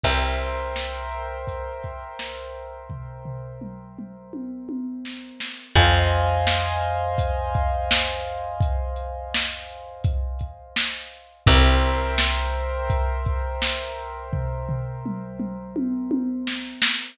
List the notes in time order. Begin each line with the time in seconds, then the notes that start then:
0.03 C2 A#4 C5 E5 G5, kick, closed hi-hat
0.41 closed hi-hat
0.76 snare
1.11 closed hi-hat
1.47 kick, closed hi-hat
1.83 kick, closed hi-hat
2.19 snare
2.55 closed hi-hat
2.90 kick, floor tom
3.25 floor tom
3.61 mid tom
3.99 mid tom
4.33 high tom
4.69 high tom
5.05 snare
5.40 snare
5.75 F2 C5 D#5 F5 G#5, kick, closed hi-hat
6.12 closed hi-hat
6.47 snare
6.84 closed hi-hat
7.18 kick, closed hi-hat
7.54 kick, closed hi-hat
7.91 snare
8.26 closed hi-hat
8.60 kick, closed hi-hat
8.96 closed hi-hat
9.34 snare
9.69 closed hi-hat
10.04 kick, closed hi-hat
10.39 kick, closed hi-hat
10.76 snare
11.13 closed hi-hat
11.46 C2 A#4 C5 E5 G5, kick, closed hi-hat
11.83 closed hi-hat
12.18 snare
12.55 closed hi-hat
12.90 kick, closed hi-hat
13.25 kick, closed hi-hat
13.62 snare
13.97 closed hi-hat
14.33 kick, floor tom
14.69 floor tom
15.06 mid tom
15.40 mid tom
15.76 high tom
16.11 high tom
16.47 snare
16.82 snare